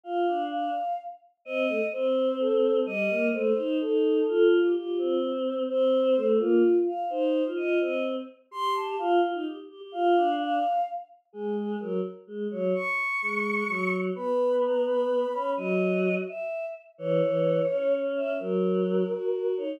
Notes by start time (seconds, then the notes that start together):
0.03 F4 F5
0.27 D4
0.51 F5
1.45 C4 D#5
1.69 A3
1.92 C4 C5
2.39 A4
2.85 G3 D#5
3.10 A#3
3.33 A3 C5
3.56 D#4
3.80 D#4 A4
4.27 F4 A4
4.51 F4
4.64 G4
4.75 F4 G4
4.98 C4
5.68 C4 C5
6.16 A3
6.39 A#3 F4
6.86 F5
7.09 D#4 C5
7.45 F4
7.56 F4 D#5
7.80 C4 D#5
8.51 G4 C6
8.75 A5
8.98 F4 F5
9.21 F4
9.33 D#4
9.45 G4
9.69 G4
9.81 G4
9.92 F4 F5
10.16 D4
10.39 F5
11.33 G#3 G#4
11.57 G#4
11.80 F#3 A#4
12.27 G#3
12.51 F#3 C#5
12.75 C#6
13.22 G#3
13.68 F#3
14.15 B3 B5
14.62 A#5
14.86 B5
15.33 C#4
15.57 F#3 D#5
16.27 E5
16.98 E3 C#5
17.22 E3
17.69 C#4
18.16 E5
18.39 F#3 A#4
19.09 F#4
19.33 F#4
19.57 D#4 C#5